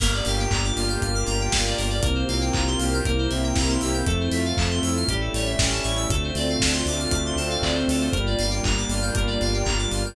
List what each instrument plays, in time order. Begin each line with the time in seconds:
0.00 synth bass 1 G1, lead 2 (sawtooth) A#3, string ensemble 1 A#3 D4 F4 G4, electric piano 2 A#4, kick, crash
0.13 electric piano 2 D5
0.25 synth bass 1 G1, lead 2 (sawtooth) G4, electric piano 2 F5, open hi-hat
0.40 electric piano 2 G5
0.51 synth bass 1 G1, lead 2 (sawtooth) A#3, electric piano 2 A#5, kick, clap
0.64 electric piano 2 D6
0.76 synth bass 1 G1, lead 2 (sawtooth) F4, electric piano 2 F6, open hi-hat
0.89 electric piano 2 G6
1.02 synth bass 1 G1, string ensemble 1 A#3 D4 G4 A#4, lead 2 (sawtooth) A#3, electric piano 2 F6, kick, closed hi-hat
1.15 electric piano 2 D6
1.27 synth bass 1 G1, lead 2 (sawtooth) G4, electric piano 2 A#5, open hi-hat
1.41 electric piano 2 G5
1.52 synth bass 1 G1, lead 2 (sawtooth) F4, electric piano 2 F5, kick, snare
1.66 electric piano 2 D5
1.78 synth bass 1 G1, lead 2 (sawtooth) A#3, electric piano 2 A#4, open hi-hat
1.90 electric piano 2 D5
2.03 synth bass 1 C2, lead 2 (sawtooth) A#3, string ensemble 1 A#3 C4 F4 G4, electric piano 2 A#4, kick, closed hi-hat
2.15 electric piano 2 C5
2.28 synth bass 1 C2, lead 2 (sawtooth) C4, electric piano 2 F5, open hi-hat
2.41 electric piano 2 G5
2.53 synth bass 1 C2, string ensemble 1 A#3 C4 G4 A#4, lead 2 (sawtooth) F4, electric piano 2 A#5, kick, clap
2.67 electric piano 2 C6
2.79 synth bass 1 C2, lead 2 (sawtooth) G4, electric piano 2 F6, open hi-hat
2.94 electric piano 2 G6
3.05 synth bass 1 C2, lead 2 (sawtooth) A#3, string ensemble 1 A#3 C4 E4 G4, electric piano 2 A#4, kick, closed hi-hat
3.18 electric piano 2 C5
3.30 synth bass 1 C2, lead 2 (sawtooth) C4, electric piano 2 E5, open hi-hat
3.44 electric piano 2 G5
3.55 synth bass 1 C2, string ensemble 1 A#3 C4 G4 A#4, lead 2 (sawtooth) E4, electric piano 2 A#5, kick, snare
3.69 electric piano 2 C6
3.81 synth bass 1 C2, lead 2 (sawtooth) G4, electric piano 2 E6, open hi-hat
3.94 electric piano 2 G6
4.06 synth bass 1 F2, string ensemble 1 A3 C4 E4 F4, lead 2 (sawtooth) A3, electric piano 2 A4, kick, closed hi-hat
4.20 electric piano 2 C5
4.31 synth bass 1 F2, lead 2 (sawtooth) F4, electric piano 2 E5, open hi-hat
4.45 electric piano 2 F5
4.57 synth bass 1 F2, lead 2 (sawtooth) A3, string ensemble 1 A3 C4 F4 A4, electric piano 2 A5, kick, clap
4.71 electric piano 2 C6
4.83 synth bass 1 F2, lead 2 (sawtooth) E4, electric piano 2 E6, open hi-hat
4.97 electric piano 2 F6
5.08 synth bass 1 A1, string ensemble 1 G3 A3 C#4 E4, lead 2 (sawtooth) G3, electric piano 2 G4, kick, closed hi-hat
5.21 electric piano 2 A4
5.34 synth bass 1 A1, lead 2 (sawtooth) A3, electric piano 2 C#5, open hi-hat
5.46 electric piano 2 E5
5.58 synth bass 1 A1, string ensemble 1 G3 A3 E4 G4, lead 2 (sawtooth) C#4, electric piano 2 G5, kick, snare
5.72 electric piano 2 A5
5.84 synth bass 1 A1, lead 2 (sawtooth) E4, electric piano 2 C#6, open hi-hat
5.97 electric piano 2 E6
6.10 synth bass 1 D2, lead 2 (sawtooth) A3, string ensemble 1 A3 C4 D4 F4, electric piano 2 A4, kick, closed hi-hat
6.24 electric piano 2 C5
6.35 synth bass 1 D2, lead 2 (sawtooth) C4, electric piano 2 D5, open hi-hat
6.50 electric piano 2 F5
6.60 synth bass 1 D2, lead 2 (sawtooth) D4, electric piano 2 A5, kick, snare
6.73 electric piano 2 C6
6.86 synth bass 1 D2, lead 2 (sawtooth) F4, electric piano 2 D6, open hi-hat
6.99 electric piano 2 F6
7.11 synth bass 1 D2, lead 2 (sawtooth) A3, string ensemble 1 A3 C4 F4 A4, electric piano 2 D6, kick, closed hi-hat
7.26 electric piano 2 C6
7.36 synth bass 1 D2, lead 2 (sawtooth) C4, electric piano 2 A5, open hi-hat
7.50 electric piano 2 F5
7.62 synth bass 1 D2, lead 2 (sawtooth) D4, electric piano 2 D5, kick, clap
7.74 electric piano 2 C5
7.88 synth bass 1 D2, lead 2 (sawtooth) F4, electric piano 2 A4, open hi-hat
8.01 electric piano 2 C5
8.12 synth bass 1 G1, string ensemble 1 G3 A#3 D4 F4, lead 2 (sawtooth) G3, electric piano 2 A#4, kick, closed hi-hat
8.26 electric piano 2 D5
8.39 synth bass 1 G1, lead 2 (sawtooth) A#3, electric piano 2 F5, open hi-hat
8.51 electric piano 2 G5
8.63 synth bass 1 G1, lead 2 (sawtooth) D4, electric piano 2 A#5, kick, clap
8.77 electric piano 2 D6
8.89 synth bass 1 G1, lead 2 (sawtooth) F4, electric piano 2 F6, open hi-hat
9.02 electric piano 2 G6
9.15 synth bass 1 G1, string ensemble 1 G3 A#3 F4 G4, lead 2 (sawtooth) G3, electric piano 2 A#4, kick, closed hi-hat
9.27 electric piano 2 D5
9.41 synth bass 1 G1, lead 2 (sawtooth) A#3, electric piano 2 F5, open hi-hat
9.54 electric piano 2 G5
9.65 synth bass 1 G1, lead 2 (sawtooth) D4, electric piano 2 A#5, kick, clap
9.78 electric piano 2 D6
9.91 synth bass 1 G1, lead 2 (sawtooth) F4, electric piano 2 F6, open hi-hat
10.06 electric piano 2 G6